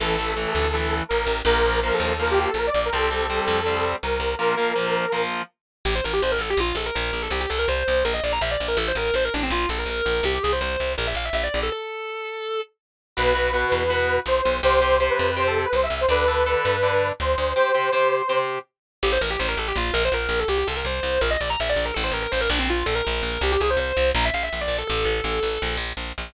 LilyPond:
<<
  \new Staff \with { instrumentName = "Lead 2 (sawtooth)" } { \time 4/4 \key a \phrygian \tempo 4 = 164 a'2. bes'4 | bes'4 bes'16 a'8 a'16 bes'16 g'16 g'16 a'16 bes'16 d''8 bes'16 | a'2. bes'4 | bes'2~ bes'8 r4. |
r1 | r1 | r1 | r1 |
r1 | \key b \phrygian b'2. c''4 | c''4 c''16 b'8 b'16 c''16 a'16 a'16 b'16 c''16 e''8 c''16 | b'2. c''4 |
c''2~ c''8 r4. | \key a \phrygian r1 | r1 | r1 |
r1 | r1 | }
  \new Staff \with { instrumentName = "Distortion Guitar" } { \time 4/4 \key a \phrygian r1 | r1 | r1 | r1 |
g'16 c''16 bes'16 g'16 c''16 bes'16 a'16 g'16 f'8 a'16 bes'16 bes'8. a'16 | g'16 g'16 a'16 bes'16 c''4 bes'16 ees''16 d''16 bes''16 e''16 d''8 bes'16 | a'16 c''16 bes'16 bes'16 c''16 bes'16 d'16 c'16 f'8 a'16 bes'16 bes'8. bes'16 | g'16 g'16 gis'16 c''16 c''4 bes'16 e''16 f''16 e''16 e''16 d''8 a'16 |
a'2~ a'8 r4. | \key b \phrygian r1 | r1 | r1 |
r1 | \key a \phrygian g'16 c''16 bes'16 g'16 c''16 bes'16 a'16 g'16 f'8 bes'16 c''16 bes'8. a'16 | g'16 g'16 a'16 bes'16 c''4 bes'16 ees''16 d''16 bes''16 e''16 d''8 bes'16 | a'16 c''16 bes'16 bes'16 c''16 bes'16 d'16 c'16 f'8 a'16 bes'16 bes'8. bes'16 |
g'16 g'16 gis'16 c''16 c''4 bes''16 e''16 f''16 e''16 e''16 d''8 a'16 | a'2~ a'8 r4. | }
  \new Staff \with { instrumentName = "Overdriven Guitar" } { \time 4/4 \key a \phrygian <e a>8 <e a>8 <e a>4 <e a>2 | <f bes>8 <f bes>8 <f bes>4 <f bes>2 | <g c'>8 <g c'>8 <g c'>4 <g c'>2 | <f bes>8 <f bes>8 <f bes>4 <f bes>2 |
r1 | r1 | r1 | r1 |
r1 | \key b \phrygian <fis' b'>8 <fis' b'>8 <fis' b'>4 <fis' b'>2 | <g' c''>8 <g' c''>8 <g' c''>4 <g' c''>2 | <a' d''>8 <a' d''>8 <a' d''>4 <a' d''>2 |
<g' c''>8 <g' c''>8 <g' c''>4 <g' c''>2 | \key a \phrygian r1 | r1 | r1 |
r1 | r1 | }
  \new Staff \with { instrumentName = "Electric Bass (finger)" } { \clef bass \time 4/4 \key a \phrygian a,,4. d,4. a,,8 a,,8 | bes,,4. ees,4. bes,,8 bes,,8 | c,4. f,4. c,8 c,8 | r1 |
a,,8 a,,8 a,,8 a,,8 bes,,8 bes,,8 bes,,8 bes,,8 | c,8 c,8 c,8 c,8 bes,,8 bes,,8 bes,,8 bes,,8 | a,,8 a,,8 a,,8 a,,8 bes,,8 bes,,8 bes,,8 bes,,8 | c,8 c,8 c,8 c,8 bes,,8 bes,,8 bes,,8 bes,,8 |
r1 | \key b \phrygian b,,4. e,4. b,,8 b,,8 | c,4. f,4. c,8 c,8 | d,4. g,4. d,8 d,8 |
r1 | \key a \phrygian a,,8 a,,8 a,,8 a,,8 bes,,8 bes,,8 bes,,8 bes,,8 | c,8 c,8 c,8 c,8 bes,,8 bes,,8 bes,,8 bes,,8 | a,,8 a,,8 a,,8 bes,,4 bes,,8 bes,,8 bes,,8 |
c,8 c,8 c,8 c,8 bes,,8 bes,,8 bes,,8 bes,,8 | a,,8 a,,8 a,,8 a,,8 bes,,8 bes,,8 bes,,8 bes,,8 | }
>>